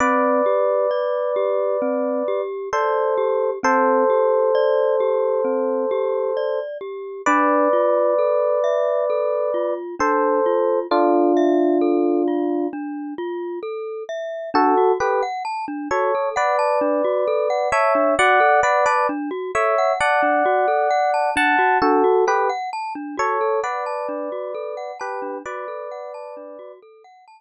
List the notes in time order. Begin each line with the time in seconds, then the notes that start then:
0.00 C4 B4 D5
0.46 G4
0.91 D5
1.36 G4
1.82 C4
2.28 G4
2.73 A4 C5 D5
3.18 G4
3.63 C4 A4 C5
4.10 G4
4.55 D5
5.00 G4
5.45 C4
5.91 G4
6.37 D5
6.81 G4
7.26 D4 B4 D5
7.73 F4
8.19 A4
8.64 E5
9.10 A4
9.54 F4
9.99 D4 A4 C5
10.46 F4
10.91 D4 F4 A4
11.37 E5
11.81 A4
12.28 F4
12.73 D4
13.18 F4
13.63 A4
14.09 E5
14.54 D4 F#4 A4
14.77 F#4
15.00 G4 A4 B4
15.23 F#5
15.45 A5
15.68 D4
15.91 F#4 A4 C#5
16.15 A4
16.36 B4 D5 F#5
16.59 A5
16.81 D4
17.05 F#4
17.27 A4
17.50 F#5
17.72 C#5 E5 A5
17.95 D4
18.19 F#4 D5 F#5
18.40 A4
18.63 B4 D5 F#5
18.86 B4 D5 A5
19.09 D4
19.31 F#4
19.55 A4 C#5 E5
19.78 F#5
20.00 D5 F#5 A5
20.23 D4
20.45 F#4
20.68 A4
20.91 F#5
21.14 A5
21.36 D4 F#5 A5
21.59 F#4
21.82 D4 F#4 A4
22.04 F#4
22.27 G4 A4 B4
22.49 F#5
22.73 A5
22.95 D4
23.17 F#4 A4 C#5
23.41 A4
23.63 B4 D5 F#5
23.86 A5
24.09 D4
24.32 F#4
24.55 A4
24.77 F#5
25.00 G4 B4 A5
25.22 D4
25.45 F#4 B4 D5
25.68 A4
25.91 F#5
26.14 A5
26.37 D4
26.59 F#4
26.82 A4
27.04 F#5
27.28 A5